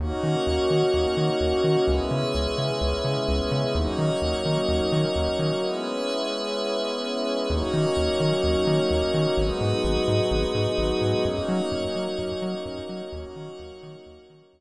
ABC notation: X:1
M:4/4
L:1/8
Q:1/4=128
K:D#phr
V:1 name="Pad 5 (bowed)"
[A,CDF]8 | [G,B,CE]8 | [F,A,CD]8 | [G,B,CE]8 |
[F,A,CD]8 | [F,G,B,D]8 | [F,A,CD]8 | [F,A,CD]8 |]
V:2 name="Pad 5 (bowed)"
[FAcd]8 | [GBce]8 | [FAcd]8 | [GBce]8 |
[FAcd]8 | [FGBd]8 | [FAcd]8 | [FAcd]8 |]
V:3 name="Synth Bass 1" clef=bass
D,, D, D,, D, D,, D, D,, D, | C,, C, C,, C, C,, C, C,, C, | D,, D, D,, D, D,, D, D,, D, | z8 |
D,, D, D,, D, D,, D, D,, D, | G,,, G,, G,,, G,, G,,, G,, G,,, G,, | F,, F, F,, F, F,, F, F,, F, | D,, D, D,, D, D,, D, D,, z |]